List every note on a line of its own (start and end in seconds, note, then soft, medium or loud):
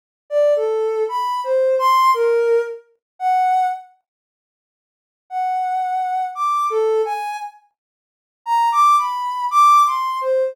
0.30 0.54 D5 medium
0.56 1.04 A4 medium
1.09 1.40 B5 medium
1.44 1.75 C5 medium
1.79 2.11 C6 loud
2.14 2.61 A#4 medium
3.19 3.67 F#5 medium
5.30 6.25 F#5 medium
6.35 6.67 D6 medium
6.70 7.02 A4 medium
7.05 7.37 G#5 medium
8.46 8.69 A#5 medium
8.72 8.96 D6 loud
8.98 9.46 B5 medium
9.51 9.82 D6 loud
9.86 10.18 C6 medium
10.21 10.53 C5 medium